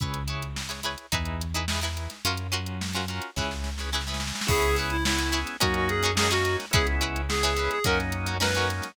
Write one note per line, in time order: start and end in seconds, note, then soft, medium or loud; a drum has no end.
0.00 0.96 C#2 medium
0.00 0.23 E4 medium
0.00 0.23 G#4 medium
0.00 0.23 B4 medium
0.00 0.23 C#5 medium
0.00 kick medium
0.00 closed hi-hat medium
0.14 closed hi-hat medium
0.27 0.61 E4 medium
0.27 0.61 G#4 medium
0.27 0.61 B4 medium
0.27 0.61 C#5 medium
0.27 closed hi-hat medium
0.42 closed hi-hat medium
0.56 snare medium
0.69 0.80 E4 medium
0.69 0.80 G#4 medium
0.69 0.80 B4 medium
0.69 0.80 C#5 medium
0.69 closed hi-hat medium
0.83 1.06 E4 medium
0.83 1.06 G#4 medium
0.83 1.06 B4 medium
0.83 1.06 C#5 medium
0.83 closed hi-hat medium
0.98 closed hi-hat medium
1.12 2.08 E2 medium
1.12 1.46 D#4 medium
1.12 1.46 E4 medium
1.12 1.46 G#4 medium
1.12 1.46 B4 medium
1.12 kick medium
1.12 closed hi-hat medium
1.25 closed hi-hat medium
1.41 closed hi-hat medium
1.54 1.66 D#4 medium
1.54 1.66 E4 medium
1.54 1.66 G#4 medium
1.54 1.66 B4 medium
1.54 closed hi-hat medium
1.68 1.80 D#4 medium
1.68 1.80 E4 medium
1.68 1.80 G#4 medium
1.68 1.80 B4 medium
1.68 snare loud
1.81 2.16 D#4 medium
1.81 2.16 E4 medium
1.81 2.16 G#4 medium
1.81 2.16 B4 medium
1.81 closed hi-hat medium
1.97 closed hi-hat medium
2.10 snare soft
2.10 closed hi-hat medium
2.25 3.20 F#2 medium
2.25 2.47 C#4 medium
2.25 2.47 F4 medium
2.25 2.47 F#4 medium
2.25 2.47 A#4 medium
2.25 closed hi-hat medium
2.37 closed hi-hat medium
2.52 2.85 C#4 medium
2.52 2.85 F4 medium
2.52 2.85 F#4 medium
2.52 2.85 A#4 medium
2.52 closed hi-hat medium
2.66 closed hi-hat medium
2.81 snare medium
2.93 3.06 C#4 medium
2.93 3.06 F4 medium
2.93 3.06 F#4 medium
2.93 3.06 A#4 medium
2.93 closed hi-hat medium
3.08 3.31 C#4 medium
3.08 3.31 F4 medium
3.08 3.31 F#4 medium
3.08 3.31 A#4 medium
3.08 closed hi-hat medium
3.22 closed hi-hat medium
3.36 4.32 C#2 medium
3.36 3.70 C#4 medium
3.36 3.70 E4 medium
3.36 3.70 G#4 medium
3.36 3.70 B4 medium
3.36 kick medium
3.36 snare medium
3.51 snare medium
3.64 snare medium
3.78 3.90 C#4 medium
3.78 3.90 E4 medium
3.78 3.90 G#4 medium
3.78 3.90 B4 medium
3.78 snare medium
3.92 4.04 C#4 medium
3.92 4.04 E4 medium
3.92 4.04 G#4 medium
3.92 4.04 B4 medium
3.92 snare medium
4.01 snare medium
4.07 4.40 C#4 medium
4.07 4.40 E4 medium
4.07 4.40 G#4 medium
4.07 4.40 B4 medium
4.07 snare medium
4.14 snare medium
4.20 snare medium
4.27 snare medium
4.35 snare medium
4.41 snare medium
4.47 5.44 C#2 medium
4.47 4.97 B3 medium
4.47 4.97 C#4 medium
4.47 4.71 C#4 medium
4.47 4.97 E4 loud
4.47 4.71 E4 medium
4.47 4.97 G#4 medium
4.47 4.76 G#4 loud
4.47 4.71 G#4 loud
4.47 4.71 B4 medium
4.47 kick loud
4.47 crash medium
4.62 closed hi-hat medium
4.76 5.11 C#4 medium
4.76 5.11 E4 medium
4.76 5.11 G#4 medium
4.76 5.11 B4 medium
4.76 closed hi-hat medium
4.90 5.04 E4 medium
4.90 closed hi-hat medium
5.05 5.57 B3 medium
5.05 5.57 C#4 medium
5.05 5.39 E4 medium
5.05 5.57 E4 medium
5.05 5.57 G#4 medium
5.05 snare loud
5.18 5.30 C#4 medium
5.18 5.30 E4 medium
5.18 5.30 G#4 medium
5.18 5.30 B4 medium
5.18 snare soft
5.18 closed hi-hat medium
5.32 5.55 C#4 medium
5.32 5.55 E4 medium
5.32 5.55 G#4 medium
5.32 5.55 B4 medium
5.32 closed hi-hat medium
5.46 snare soft
5.46 closed hi-hat medium
5.60 6.57 F#2 medium
5.60 6.11 A#3 medium
5.60 6.11 C#4 medium
5.60 5.94 C#4 medium
5.60 6.11 D#4 medium
5.60 5.94 D#4 medium
5.60 6.11 F#4 medium
5.60 5.74 F#4 medium
5.60 5.94 F#4 medium
5.60 5.94 A#4 medium
5.60 kick medium
5.60 closed hi-hat loud
5.74 5.88 F#4 medium
5.74 closed hi-hat medium
5.89 6.12 G#4 medium
5.89 closed hi-hat medium
6.03 6.15 C#4 medium
6.03 6.15 D#4 medium
6.03 6.15 F#4 medium
6.03 6.15 A#4 medium
6.03 closed hi-hat medium
6.15 6.66 A#3 medium
6.15 6.66 C#4 medium
6.15 6.28 C#4 medium
6.15 6.66 D#4 medium
6.15 6.28 D#4 medium
6.15 6.66 F#4 medium
6.15 6.28 F#4 medium
6.15 6.30 G#4 medium
6.15 6.28 A#4 medium
6.15 snare loud
6.31 6.64 C#4 medium
6.31 6.64 D#4 medium
6.31 6.56 F#4 loud
6.31 6.64 F#4 medium
6.31 6.64 A#4 medium
6.31 snare soft
6.31 closed hi-hat medium
6.45 closed hi-hat medium
6.60 snare medium
6.60 closed hi-hat medium
6.71 7.69 C#2 medium
6.71 7.21 G#3 medium
6.71 7.21 B3 medium
6.71 7.21 C#4 medium
6.71 6.95 C#4 loud
6.71 7.21 E4 loud
6.71 6.95 E4 medium
6.71 6.86 G#4 medium
6.71 6.95 G#4 medium
6.71 kick loud
6.71 closed hi-hat loud
6.75 6.95 B4 medium
6.87 closed hi-hat medium
7.01 7.34 C#4 medium
7.01 7.34 E4 medium
7.01 7.34 G#4 medium
7.01 7.34 B4 medium
7.01 closed hi-hat medium
7.16 closed hi-hat medium
7.29 7.79 G#3 medium
7.29 7.79 B3 medium
7.29 7.79 C#4 medium
7.29 7.79 E4 medium
7.29 7.70 G#4 medium
7.29 snare loud
7.43 7.54 C#4 medium
7.43 7.54 E4 medium
7.43 7.54 G#4 medium
7.43 7.54 B4 medium
7.43 closed hi-hat medium
7.57 7.79 C#4 medium
7.57 7.79 E4 medium
7.57 7.79 G#4 medium
7.57 7.79 B4 medium
7.57 closed hi-hat medium
7.71 7.84 G#4 medium
7.71 closed hi-hat medium
7.84 8.81 F#2 medium
7.84 8.36 F#3 loud
7.84 8.36 A#3 medium
7.84 8.18 C#4 medium
7.84 8.36 C#4 medium
7.84 8.36 D#4 loud
7.84 8.18 D#4 medium
7.84 8.18 F#4 medium
7.84 7.98 A#4 medium
7.84 8.18 A#4 medium
7.84 kick medium
7.84 closed hi-hat loud
8.00 snare soft
8.00 closed hi-hat medium
8.12 closed hi-hat medium
8.26 8.38 C#4 medium
8.26 8.38 D#4 medium
8.26 8.38 F#4 medium
8.26 8.38 A#4 medium
8.26 closed hi-hat medium
8.40 8.92 F#3 medium
8.40 8.92 A#3 medium
8.40 8.51 C#4 medium
8.40 8.92 C#4 medium
8.40 8.51 D#4 medium
8.40 8.92 D#4 medium
8.40 8.51 F#4 medium
8.40 8.51 A#4 medium
8.40 8.67 B4 medium
8.40 snare loud
8.55 8.89 C#4 medium
8.55 8.89 D#4 medium
8.55 8.89 F#4 medium
8.55 8.89 A#4 medium
8.55 closed hi-hat medium
8.70 closed hi-hat medium
8.82 snare medium
8.82 closed hi-hat medium